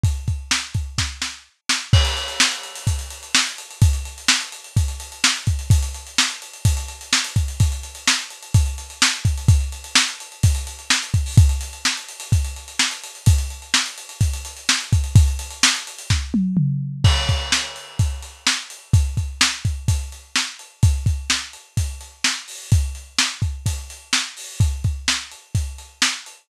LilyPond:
\new DrumStaff \drummode { \time 4/4 \tempo 4 = 127 <hh bd>8 <hh bd>8 sn8 <hh bd>8 <bd sn>8 sn8 r8 sn8 | <cymc bd>16 hh16 hh16 hh16 sn16 hh16 hh16 hh16 <hh bd>16 hh16 hh16 hh16 sn16 hh16 hh16 hh16 | <hh bd>16 hh16 hh16 hh16 sn16 hh16 hh16 hh16 <hh bd>16 hh16 hh16 hh16 sn16 hh16 <hh bd>16 hh16 | <hh bd>16 hh16 hh16 hh16 sn16 hh16 hh16 hh16 <hh bd>16 hh16 hh16 hh16 sn16 hh16 <hh bd>16 hh16 |
<hh bd>16 hh16 hh16 hh16 sn16 hh16 hh16 hh16 <hh bd>16 hh16 hh16 hh16 sn16 hh16 <hh bd>16 hh16 | <hh bd>16 hh16 hh16 hh16 sn16 hh16 hh16 hh16 <hh bd>16 hh16 hh16 hh16 sn16 hh16 <hh bd>16 hho16 | <hh bd>16 hh16 hh16 hh16 sn16 hh16 hh16 hh16 <hh bd>16 hh16 hh16 hh16 sn16 hh16 hh16 hh16 | <hh bd>16 hh16 hh16 hh16 sn16 hh16 hh16 hh16 <hh bd>16 hh16 hh16 hh16 sn16 hh16 <hh bd>16 hh16 |
<hh bd>16 hh16 hh16 hh16 sn16 hh16 hh16 hh16 <bd sn>8 tommh8 toml4 | <cymc bd>8 <hh bd>8 sn8 hh8 <hh bd>8 hh8 sn8 hh8 | <hh bd>8 <hh bd>8 sn8 <hh bd>8 <hh bd>8 hh8 sn8 hh8 | <hh bd>8 <hh bd>8 sn8 hh8 <hh bd>8 hh8 sn8 hho8 |
<hh bd>8 hh8 sn8 <hh bd>8 <hh bd>8 hh8 sn8 hho8 | <hh bd>8 <hh bd>8 sn8 hh8 <hh bd>8 hh8 sn8 hh8 | }